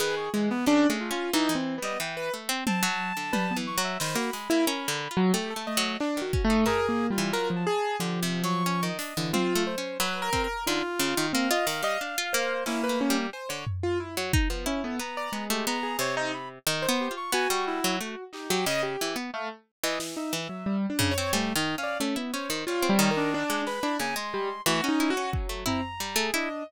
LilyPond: <<
  \new Staff \with { instrumentName = "Acoustic Grand Piano" } { \time 4/4 \tempo 4 = 90 gis'8 gis16 r16 \tuplet 3/2 { d'8 a8 f'8 dis'8 c'8 b8 } r16 b'16 r8 | r4 b'16 b16 r8 c''16 fis'16 r16 e'16 ais'8 r16 fis16 | g'16 a'16 dis''8 \tuplet 3/2 { d'8 fis'8 a8 ais'8 ais8 g8 } ais'16 f16 gis'8 | f4. r16 e16 f'8 c''8 \tuplet 3/2 { b'8 ais'8 ais'8 } |
dis'16 r8. c'16 dis''16 r16 dis''16 r8 c''8 e'16 b'16 cis'16 r16 | c''16 cis''16 r16 f'16 e'16 r8 b16 cis'16 b16 r16 d''16 gis8. gis'16 | c''16 dis'16 r8. c''8 r16 fis'4. dis'16 g'16 | dis''16 g'8 r16 a16 r8 dis''16 e16 dis'16 r16 fis16 \tuplet 3/2 { g8 d'8 cis''8 } |
r8. d''16 cis'16 b16 cis''16 r16 \tuplet 3/2 { f'8 g8 ais'8 } d'8 b'16 d'16 | ais16 r16 g16 r16 \tuplet 3/2 { fis'8 dis'8 fis'8 } fis8 c'16 r8 gis'16 dis''8 | }
  \new Staff \with { instrumentName = "Clarinet" } { \time 4/4 b'16 cis'''16 r16 b16 cis'8 f'8 r8. dis''16 g''16 r8 c'16 | a''4. cis'''16 e''16 b''2 | r8 a8 r4 \tuplet 3/2 { gis'4 f'4 a''4 } | \tuplet 3/2 { g'4 cis'''4 dis''4 } r2 |
f'4 f''2 ais4 | r2 r16 a'16 ais''8. g'16 ais''8 | cis''16 c''16 b''16 r8. g'16 cis'''16 gis''16 cis'''16 e'8 r8 g'8 | r4 f''16 r4 e''4 r8 cis''16 |
\tuplet 3/2 { a8 dis'8 f''8 } r8 c''8 cis''8. d'8. b''8 | gis''16 c'''8. a16 cis'8 r8. ais''4 d'8 | }
  \new Staff \with { instrumentName = "Pizzicato Strings" } { \time 4/4 dis8 e8 \tuplet 3/2 { cis8 gis8 cis'8 } e16 e8 g16 e8 a16 c'16 | c'16 fis8 d16 \tuplet 3/2 { g8 e8 fis8 } dis16 ais16 gis16 ais16 \tuplet 3/2 { cis'8 d8 f'8 } | \tuplet 3/2 { a8 a8 fis8 } r16 dis16 cis'16 dis'16 a16 r8 e16 fis8 r8 | \tuplet 3/2 { d8 c8 fis8 } cis'16 dis16 d'16 d16 \tuplet 3/2 { c'8 a8 cis'8 } fis8 c'16 r16 |
d16 r16 cis16 dis16 ais16 f'16 dis16 g16 d'16 f'16 ais8 \tuplet 3/2 { cis'8 a8 g8 } | r16 d16 r8. fis16 dis'16 f16 e'8 b8 b16 a16 b8 | c4 \tuplet 3/2 { dis8 b8 f'8 } b16 g8 fis16 a16 r8 fis16 | cis8 e16 b16 r8. e16 r8 e16 r8. cis16 c'16 |
\tuplet 3/2 { g8 dis8 cis'8 } a16 e'16 cis'16 dis16 g16 c'16 dis8. gis8 e'16 | cis16 gis8. e16 dis'16 e'16 cis'8 a16 e'16 r16 g16 a16 e'16 r16 | }
  \new DrumStaff \with { instrumentName = "Drums" } \drummode { \time 4/4 r4 r4 r4 r4 | tommh4 tommh4 sn8 hh8 r4 | r4 hc8 bd8 tomfh4 r4 | r4 r8 hh8 tommh4 r8 bd8 |
r4 r8 hh8 r4 sn4 | cb8 tomfh8 r8 bd8 r4 r4 | r4 r4 r4 r8 hc8 | r4 r4 sn4 r8 tomfh8 |
cb4 r4 r4 r8 sn8 | r4 r4 bd8 tomfh8 r4 | }
>>